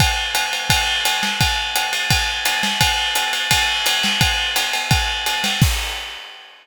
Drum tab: CC |--------|--------|--------|--------|
RD |x-xxx-xx|x-xxx-xx|x-xxx-xx|x-xxx-xx|
HH |--p---p-|--p---p-|--p---p-|--p---p-|
SD |-------o|-------o|-------o|-------o|
BD |o---o---|o---o---|o---o---|o---o---|

CC |x-------|
RD |--------|
HH |--------|
SD |--------|
BD |o-------|